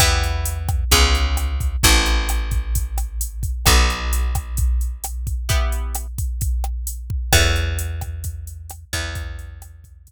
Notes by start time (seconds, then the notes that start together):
0.00 E2 B3 E4 G4, kick, cross-stick, closed hi-hat
0.23 closed hi-hat
0.45 closed hi-hat
0.69 kick, cross-stick, closed hi-hat
0.91 C#2 B3 C#4 F4 G#4, kick, closed hi-hat
1.15 closed hi-hat
1.37 cross-stick, closed hi-hat
1.60 kick, closed hi-hat
1.83 A1 C4 E4 F#4 A4, kick, closed hi-hat
2.06 closed hi-hat
2.29 cross-stick, closed hi-hat
2.51 kick, closed hi-hat
2.75 kick, closed hi-hat
2.98 cross-stick, closed hi-hat
3.21 closed hi-hat
3.43 kick, closed hi-hat
3.66 B1 B3 D#4 F#4 A4, kick, cross-stick, closed hi-hat
3.90 closed hi-hat
4.13 closed hi-hat
4.35 kick, cross-stick, closed hi-hat
4.57 kick, closed hi-hat
4.81 closed hi-hat
5.04 cross-stick, closed hi-hat
5.27 kick, closed hi-hat
5.49 B3 E4 G4, kick, closed hi-hat
5.72 closed hi-hat
5.95 cross-stick, closed hi-hat
6.18 kick, closed hi-hat
6.41 kick, closed hi-hat
6.64 cross-stick
6.87 closed hi-hat
7.10 kick
7.33 E2 A4 C#5 E5 F#5, kick, cross-stick, open hi-hat
7.56 closed hi-hat
7.79 closed hi-hat
8.01 kick, cross-stick, closed hi-hat
8.24 kick, closed hi-hat
8.47 closed hi-hat
8.70 cross-stick, closed hi-hat
8.93 E2 B4 E5 G5, kick, closed hi-hat
9.15 kick, closed hi-hat
9.39 closed hi-hat
9.62 cross-stick, closed hi-hat
9.84 kick, closed hi-hat
10.07 kick, closed hi-hat